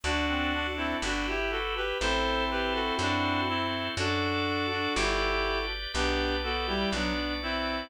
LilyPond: <<
  \new Staff \with { instrumentName = "Clarinet" } { \time 2/2 \key g \major \tempo 2 = 61 <d' fis'>4. <c' e'>8 <d' fis'>8 <e' g'>8 <fis' a'>8 <g' b'>8 | <a' c''>4 <g' b'>8 <fis' a'>8 <d' fis'>4 <c' e'>4 | <d' fis'>4. <d' fis'>8 <e' g'>4. r8 | <g' b'>4 <fis' a'>8 <e' g'>8 <b d'>4 <c' e'>4 | }
  \new Staff \with { instrumentName = "Clarinet" } { \time 2/2 \key g \major d'8 c'8 d'4 r2 | <c' e'>1 | <fis' a'>1 | <b d'>4 b8 g8 fis8 r4. | }
  \new Staff \with { instrumentName = "Drawbar Organ" } { \time 2/2 \key g \major <d' fis' a'>2 <e' g' b'>2 | <e' a' c''>2 <fis' a' c''>2 | <fis' a' d''>2 <g' b' d''>2 | <g' b' d''>2 <fis' b' d''>2 | }
  \new Staff \with { instrumentName = "Electric Bass (finger)" } { \clef bass \time 2/2 \key g \major d,2 g,,2 | a,,2 fis,2 | fis,2 g,,2 | b,,2 b,,2 | }
>>